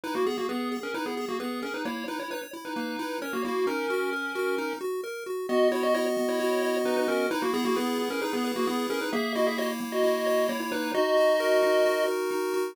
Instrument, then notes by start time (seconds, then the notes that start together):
lead 1 (square)
0.04 D#4 E4 B4
0.15 A#3 F#4
0.26 B3 G#4
0.38 A#3 F#4
0.49 B3 G#4 B4
0.72 G#4
0.83 C#4 A#4
0.94 D#4 E4 B4
1.06 B3 G#4
1.17 G#4
1.29 A#3 F#4
1.40 B3 G#4 B4
1.62 C#4 G#4 A#4
1.74 D#4 B4
1.85 A#3 E4 C#5
2.08 D#4 E4 B4
2.19 E4 C#5
2.31 D#4 B4 C#5
2.53 E4
2.65 D#4 B4
2.76 A#3
2.99 E4
3.22 C#4 A#4 C#5
3.33 A#3 F#4
3.44 A#3 E4 F#4
3.67 C#4 D#4 A#4
3.90 F#4
4.13 A#4
4.35 F#4
4.58 D#4
4.81 F#4
5.04 A#4
5.26 F#4
5.49 B3 F#4 D#5
5.71 E4 F#4 C#5
5.83 F#4 D#5
5.94 E4 C#5 D#5
6.17 B3
6.29 E4 C#5
6.40 F#4
6.62 D#5
6.85 B3 D#4 B4
6.97 D#4 B4
7.08 C#4 F#4 A#4
7.31 D#4 E4 B4
7.42 A#3 F#4
7.54 B3 G#4
7.65 A#3 F#4
7.76 B3 G#4 B4
7.99 E4
8.10 C#4 A#4
8.21 D#4 G#4 B4
8.33 B3 G#4
8.44 B4
8.56 A#3 F#4
8.67 B3 E4 G#4
8.90 C#4 G#4 A#4
9.01 D#4 B4
9.13 A#3 G#4 E5
9.35 E4 F#4 D#5
9.47 G#4 E5
9.58 F#4 C#5 D#5
9.81 A#3
9.92 F#4 D#5
10.03 E4
10.26 C#5
10.49 A#3 E4 C#5
10.60 E4 C#5
10.72 D#4 E4 B4
10.94 D#4 F#4 D#5
11.17 F#4
11.40 A#4
11.63 D#4
11.85 F#4
12.08 A#4
12.31 D#4
12.54 F#4